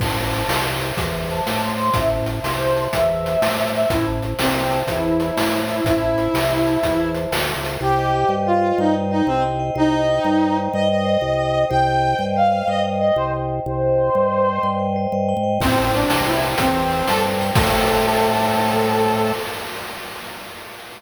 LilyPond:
<<
  \new Staff \with { instrumentName = "Brass Section" } { \time 12/8 \key a \phrygian \tempo 4. = 123 a''2 r2 a''4 c'''4 | e''8 r4 c''4. e''2~ e''8 e''8 | e'8 r4 c'4. e'2~ e'8 e'8 | e'1 r2 |
\key c \phrygian g'2 f'4 ees'8 r8 ees'8 c'8 r4 | ees'2. ees''8 ees''2~ ees''8 | g''2 f''4 ees''8 r8 ees''8 c''8 r4 | c''2.~ c''8 r2 r8 |
\key a \phrygian c'4 d'4 e'8 r8 c'4. a'8 r4 | a'1. | }
  \new Staff \with { instrumentName = "Vibraphone" } { \time 12/8 \key a \phrygian c''8 a''8 c''8 e''8 c''8 a''8 e''8 c''8 c''8 a''8 c''8 c''8~ | c''8 a''8 c''8 e''8 c''8 a''8 e''8 c''8 c''8 a''8 c''8 e''8 | c''8 a''8 c''8 e''8 c''8 a''8 e''8 c''8 c''8 a''8 c''8 e''8 | c''8 a''8 c''8 e''8 c''8 a''8 e''8 c''8 c''8 a''8 c''8 e''8 |
\key c \phrygian c''8 ees''8 g''8 ees''8 c''8 ees''8 g''8 ees''8 c''8 ees''8 g''8 ees''8 | c''8 ees''8 g''8 ees''8 c''8 ees''8 g''8 ees''8 c''8 ees''8 g''8 ees''8 | c''8 ees''8 g''8 ees''8 c''8 ees''8 g''8 ees''8 c''8 ees''8 g''8 ees''8 | c''8 ees''8 g''8 ees''8 c''8 ees''8 g''8 ees''8 c''8 ees''8 g''8 ees''8 |
\key a \phrygian c''8 a''8 c''8 g''8 c''8 a''8 g''8 c''8 c''8 a''8 c''8 g''8 | <c'' e'' g'' a''>1. | }
  \new Staff \with { instrumentName = "Drawbar Organ" } { \clef bass \time 12/8 \key a \phrygian a,,4. c,4. e,4. a,4. | a,,4. c,4. e,4. a,4. | a,,4. c,4. e,4. a,4. | a,,4. c,4. e,4. d,8. des,8. |
\key c \phrygian c,4. g,4. g,4. c,4. | c,4. g,4. g,4. c,4. | c,4. g,4. g,4. c,4. | c,4. g,4. g,4. g,8. aes,8. |
\key a \phrygian a,,4. c,4. e,4. g,4. | a,1. | }
  \new DrumStaff \with { instrumentName = "Drums" } \drummode { \time 12/8 <cymc bd>4 hh8 sn4 hh8 <hh bd>4 hh8 sn4 hh8 | <hh bd>4 hh8 sn4 hh8 <hh bd>4 hh8 sn4 hh8 | <hh bd>4 hh8 sn4 hh8 <hh bd>4 hh8 sn4 hh8 | <hh bd>4 hh8 sn4 hh8 <hh bd>4 hh8 sn4 hh8 |
r4. r4. r4. r4. | r4. r4. r4. r4. | r4. r4. r4. r4. | r4. r4. r4. r4. |
<cymc bd>4 hh8 sn4 hh8 <hh bd>4 hh8 sn4 hh8 | <cymc bd>4. r4. r4. r4. | }
>>